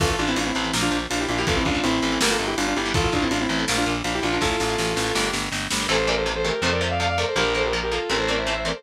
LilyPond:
<<
  \new Staff \with { instrumentName = "Lead 2 (sawtooth)" } { \time 4/4 \key a \phrygian \tempo 4 = 163 <f' a'>16 <f' a'>16 <d' f'>16 <c' e'>16 <d' f'>16 <c' e'>8. r16 <d' f'>8 r16 <d' f'>16 <e' g'>16 <d' f'>16 <e' g'>16 | <f' a'>16 <c' e'>16 <d' f'>8 <c' e'>4 <g' bes'>16 <f' a'>8 <e' g'>16 <d' f'>16 <d' f'>16 <e' g'>8 | <f' a'>16 <f' a'>16 <d' f'>16 <c' e'>16 <d' f'>16 <c' e'>8. r16 <d' f'>8 r16 <d' f'>16 <e' g'>16 <d' f'>16 <d' f'>16 | <f' a'>2~ <f' a'>8 r4. |
r1 | r1 | }
  \new Staff \with { instrumentName = "Distortion Guitar" } { \time 4/4 \key a \phrygian r1 | r1 | r1 | r1 |
<a' c''>8 <bes' d''>16 <a' c''>16 r16 <a' c''>16 <g' bes'>8 <a' c''>16 <bes' d''>16 <c'' e''>16 <d'' f''>16 <d'' f''>16 <d'' f''>16 <bes' d''>16 <a' c''>16 | <g' bes'>8 <a' c''>16 <g' bes'>16 r16 <g' bes'>16 <f' a'>8 <g' bes'>16 <a' c''>16 <bes' d''>16 <c'' e''>16 <c'' e''>16 <c'' e''>16 <bes' d''>16 <a' c''>16 | }
  \new Staff \with { instrumentName = "Overdriven Guitar" } { \time 4/4 \key a \phrygian <e a>8. <e a>8. <e a>16 <e a>16 <f bes>4.~ <f bes>16 <f bes>16 | <e a>8. <e a>8. <e a>16 <e a>16 <d g bes>4.~ <d g bes>16 <d g bes>16 | <e' a'>8. <e' a'>8. <e' a'>16 <e' a'>16 <f' bes'>4.~ <f' bes'>16 <f' bes'>16 | <e' a'>8. <e' a'>8. <e' a'>16 <e' a'>16 <d' g' bes'>4.~ <d' g' bes'>16 <d' g' bes'>16 |
<c e a>8 <c e a>8 <c e a>8 <c e a>8 <c f a>8 <c f a>8 <c f a>8 <c f a>8 | <f bes>8 <f bes>8 <f bes>8 <f bes>8 <e a c'>8 <e a c'>8 <e a c'>8 <e a c'>8 | }
  \new Staff \with { instrumentName = "Electric Bass (finger)" } { \clef bass \time 4/4 \key a \phrygian a,,8 a,,8 a,,8 a,,8 bes,,8 bes,,8 bes,,8 bes,,8 | a,,8 a,,8 a,,8 a,,8 g,,8 g,,8 g,,8 g,,8 | a,,8 a,,8 a,,8 a,,8 bes,,8 bes,,8 bes,,8 bes,,8 | a,,8 a,,8 a,,8 a,,8 g,,8 g,,8 g,,8 g,,8 |
a,,2 f,2 | bes,,2 a,,2 | }
  \new DrumStaff \with { instrumentName = "Drums" } \drummode { \time 4/4 <cymc bd>8 cymr8 cymr8 cymr8 sn8 cymr8 cymr8 cymr8 | <bd cymr>8 <bd cymr>8 cymr8 cymr8 sn8 cymr8 cymr8 cymr8 | <bd cymr>8 <bd cymr>8 cymr8 cymr8 sn8 cymr8 cymr8 cymr8 | <bd sn>8 sn8 sn8 sn8 sn8 sn8 sn8 sn8 |
r4 r4 r4 r4 | r4 r4 r4 r4 | }
>>